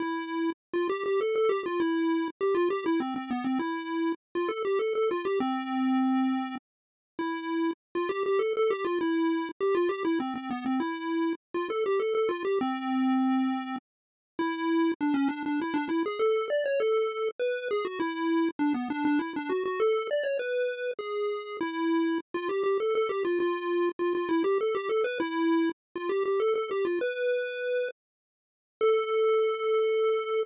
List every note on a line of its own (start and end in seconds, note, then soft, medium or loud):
0.00 0.50 E4 medium
0.73 0.88 F4 medium
0.89 1.04 G4 medium
1.06 1.20 G4 medium
1.21 1.35 A4 medium
1.35 1.50 A4 medium
1.49 1.63 G4 medium
1.66 1.80 F4 medium
1.80 2.28 E4 medium
2.41 2.55 G4 medium
2.55 2.69 F4 medium
2.70 2.85 G4 medium
2.86 3.00 E4 medium
3.00 3.15 C4 medium
3.16 3.30 C4 medium
3.31 3.45 B3 medium
3.44 3.59 C4 medium
3.59 4.12 E4 medium
4.35 4.49 F4 medium
4.49 4.63 A4 medium
4.65 4.79 G4 medium
4.79 4.94 A4 medium
4.95 5.09 A4 medium
5.11 5.25 F4 medium
5.25 5.39 G4 medium
5.40 6.56 C4 medium
7.19 7.71 E4 medium
7.95 8.09 F4 medium
8.09 8.23 G4 medium
8.26 8.40 G4 medium
8.39 8.53 A4 medium
8.57 8.71 A4 medium
8.70 8.85 G4 medium
8.85 8.99 F4 medium
9.01 9.49 E4 medium
9.61 9.75 G4 medium
9.75 9.89 F4 medium
9.89 10.03 G4 medium
10.05 10.19 E4 medium
10.20 10.34 C4 medium
10.36 10.50 C4 medium
10.51 10.65 B3 medium
10.66 10.80 C4 medium
10.80 11.33 E4 medium
11.54 11.69 F4 medium
11.70 11.84 A4 medium
11.86 12.00 G4 medium
12.00 12.14 A4 medium
12.15 12.29 A4 medium
12.29 12.43 F4 medium
12.45 12.59 G4 medium
12.61 13.76 C4 medium
14.39 14.92 E4 medium
15.01 15.15 D4 medium
15.14 15.28 C#4 medium
15.29 15.43 D4 medium
15.46 15.60 D4 medium
15.62 15.76 E4 medium
15.74 15.88 D4 medium
15.89 16.03 E4 medium
16.06 16.20 G#4 medium
16.19 16.48 A4 medium
16.50 16.64 D5 medium
16.66 16.80 C#5 medium
16.80 17.29 A4 medium
17.39 17.68 B4 medium
17.71 17.85 G#4 medium
17.85 17.99 F#4 medium
18.00 18.49 E4 medium
18.59 18.73 D4 medium
18.74 18.89 B3 medium
18.90 19.04 D4 medium
19.05 19.19 D4 medium
19.19 19.34 E4 medium
19.36 19.50 D4 medium
19.49 19.64 F#4 medium
19.66 19.80 F#4 medium
19.80 20.07 A4 medium
20.11 20.25 D5 medium
20.23 20.38 C#5 medium
20.39 20.91 B4 medium
20.99 21.57 G#4 medium
21.61 22.18 E4 medium
22.34 22.48 F4 medium
22.49 22.63 G4 medium
22.64 22.78 G4 medium
22.80 22.94 A4 medium
22.95 23.09 A4 medium
23.09 23.23 G4 medium
23.25 23.39 F4 medium
23.40 23.89 F4 medium
23.99 24.13 F4 medium
24.15 24.29 F4 medium
24.29 24.43 E4 medium
24.44 24.58 G4 medium
24.61 24.75 A4 medium
24.75 24.89 G4 medium
24.89 25.04 A4 medium
25.04 25.19 B4 medium
25.20 25.70 E4 medium
25.96 26.10 F4 medium
26.09 26.23 G4 medium
26.25 26.40 G4 medium
26.40 26.54 A4 medium
26.55 26.70 A4 medium
26.71 26.85 G4 medium
26.85 26.99 F4 medium
27.01 27.89 B4 medium
28.81 30.43 A4 loud